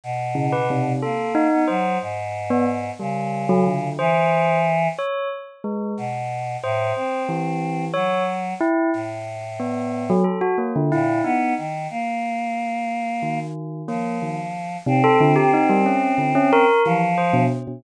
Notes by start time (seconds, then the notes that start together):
0.03 B2
0.35 C#3
0.52 B4
0.70 C3
1.02 A#3 A4
1.35 D#4
1.52 B3
1.67 F#3 C5
2.02 G#2
2.50 B3
2.99 C#3 G3
3.49 F#3
3.67 D3
3.99 E3 C5
4.98 C#5
5.64 G#3
5.97 B2
6.63 A2 C5
6.96 C4
7.29 E3
7.94 F#3 C#5
8.61 E4
8.93 A2
9.60 B3
10.10 F#3
10.24 A4
10.41 F#4
10.58 A#3
10.76 D3
10.92 A#2 E4
11.24 B3 D#4
11.58 D#3
11.90 A#3
13.22 D#3
13.88 F3 A#3
14.22 D#3
14.86 C3 C4
15.04 A4
15.21 D3
15.36 G4
15.53 D#4
15.70 G3
15.86 C#4
16.18 D3
16.35 C#4
16.53 A#4
16.85 E3 F3
17.18 C5
17.33 B2
17.67 B2